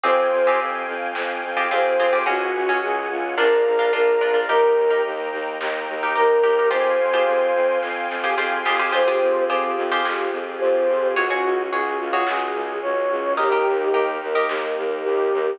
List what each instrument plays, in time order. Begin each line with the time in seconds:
0.04 violin F2, pizzicato strings C4 F4 G4 G#4, string ensemble 1 C5 F5 G5 G#5, flute C5, kick, floor tom
0.32 violin F2, floor tom
0.47 pizzicato strings C4 F4 G4 G#4
0.60 violin F2, floor tom
0.88 violin F2, floor tom
1.15 violin F2, snare
1.43 violin F2, kick, floor tom
1.57 pizzicato strings C4 F4 G4 G#4
1.71 violin F2, pizzicato strings C4 F4 G4 G#4, flute C5, floor tom
1.98 violin F2, pizzicato strings C4 F4 G4 G#4, kick, floor tom
2.13 pizzicato strings C4 F4 G4 G#4
2.26 violin C#2, pizzicato strings C#4 F#4 G#4, flute F#4, string ensemble 1 C#5 F#5 G#5, kick, floor tom
2.54 violin C#2, floor tom
2.69 pizzicato strings C#4 F#4 G#4
2.82 violin C#2, flute G#4, floor tom
3.10 violin C#2, flute F4, floor tom
3.38 violin A#1, pizzicato strings D4 F4 A#4, flute A#4, string ensemble 1 D5 F5 A#5, snare
3.66 violin A#1, floor tom
3.79 pizzicato strings D4 F4 A#4
3.93 violin A#1, pizzicato strings D4 F4 A#4, flute A#4, floor tom
4.21 violin A#1, pizzicato strings D4 F4 A#4, floor tom
4.34 pizzicato strings D4 F4 A#4
4.49 violin D#2, pizzicato strings D#4 G4 A#4, flute A#4, string ensemble 1 D#5 G5 A#5, kick, floor tom
4.76 violin D#2, floor tom
4.91 pizzicato strings D#4 G4 A#4
5.04 violin D#2, floor tom
5.32 violin D#2, floor tom
5.60 violin D#2, snare
5.87 violin D#2, kick, floor tom
6.03 pizzicato strings D#4 G4 A#4
6.15 violin D#2, pizzicato strings D#4 G4 A#4, flute A#4, floor tom
6.44 violin D#2, pizzicato strings D#4 G4 A#4, kick, floor tom
6.59 pizzicato strings D#4 G4 A#4
6.70 violin F2, pizzicato strings F4 G4 G#4 C5, flute C5, string ensemble 1 F5 G5 G#5 C6, kick, floor tom
6.99 violin F2, floor tom
7.14 pizzicato strings F4 G4 G#4 C5
7.27 violin F2, floor tom
7.54 violin F2, floor tom
7.82 violin F2, kick, snare
8.09 violin F2, snare
8.24 pizzicato strings F4 G4 G#4 C5
8.38 violin F2, pizzicato strings F4 G4 G#4 C5
8.65 violin F2, pizzicato strings F4 G4 G#4 C5, snare
8.80 pizzicato strings F4 G4 G#4 C5
8.92 violin F2, string ensemble 1 C4 F4 G4 G#4, pizzicato strings F4 G4 G#4 C5, flute C5, kick, crash
9.08 pizzicato strings F4 G4 G#4 C5
9.21 violin F2, floor tom
9.48 violin F2, pizzicato strings F4 G4 G#4 C5, floor tom
9.76 violin F2, floor tom
9.92 pizzicato strings F4 G4 G#4 C5
10.04 violin F2, snare
10.32 violin F2, floor tom
10.59 violin F2, flute C5, floor tom
10.88 violin F2, kick, floor tom
11.14 violin C#2, string ensemble 1 C#4 F#4 G#4, flute F#4, pizzicato strings F#4 G#4 C#5, kick, floor tom
11.30 pizzicato strings F#4 G#4 C#5
11.44 violin C#2, floor tom
11.71 violin C#2, pizzicato strings F#4 G#4 C#5, flute G#4, floor tom
11.99 violin C#2, flute F4, floor tom
12.13 pizzicato strings F#4 G#4 C#5
12.27 violin C#2, flute G#4, snare
12.55 violin C#2, floor tom
12.82 violin C#2, flute C#5, floor tom
13.10 violin C#2, kick, floor tom
13.36 violin D#2, string ensemble 1 D#4 G4 A#4, flute G4, pizzicato strings G4 A#4 D#5, kick, floor tom
13.52 pizzicato strings G4 A#4 D#5
13.66 violin D#2, floor tom
13.93 violin D#2, pizzicato strings G4 A#4 D#5, floor tom
14.21 violin D#2, floor tom
14.35 pizzicato strings G4 A#4 D#5
14.49 violin D#2, snare
14.77 violin D#2, kick, floor tom
15.04 violin D#2, flute G4, floor tom
15.32 violin D#2, kick, floor tom